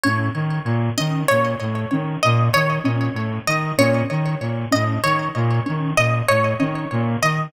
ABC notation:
X:1
M:6/8
L:1/8
Q:3/8=64
K:none
V:1 name="Brass Section" clef=bass
A,, ^D, ^A,, D, A,, =A,, | ^D, ^A,, D, A,, =A,, D, | ^A,, ^D, A,, =A,, D, ^A,, | ^D, ^A,, =A,, D, ^A,, D, |]
V:2 name="Ocarina"
^C z2 C z2 | ^C z2 C z2 | ^C z2 C z2 | ^C z2 C z2 |]
V:3 name="Orchestral Harp"
^c z2 ^d c z | z ^d ^c z2 d | ^c z2 ^d c z | z ^d ^c z2 d |]